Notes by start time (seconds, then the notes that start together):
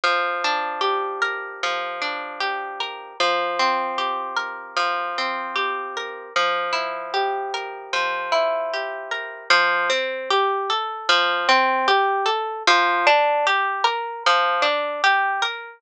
0.04 F3
0.44 D4
0.81 G4
1.22 A#4
1.63 F3
2.01 D4
2.40 G4
2.80 A#4
3.20 F3
3.59 C4
3.98 G4
4.37 A#4
4.76 F3
5.18 C4
5.56 G4
5.97 A#4
6.36 F3
6.73 E4
7.14 G4
7.54 A#4
7.93 F3
8.32 E4
8.74 G4
9.11 A#4
9.50 F3
9.90 C4
10.30 G4
10.70 A4
11.09 F3
11.49 C4
11.88 G4
12.26 A4
12.67 F3
13.07 D4
13.47 G4
13.84 A#4
14.26 F3
14.62 D4
15.04 G4
15.42 A#4